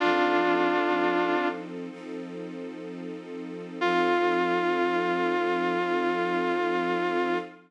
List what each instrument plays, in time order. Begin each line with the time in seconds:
0.00 string ensemble 1 F3 C4 D#4 A4, distortion guitar D4 F4
1.90 string ensemble 1 F3 C4 D#4 A4
3.81 string ensemble 1 F3 C4 D#4 A4, distortion guitar F4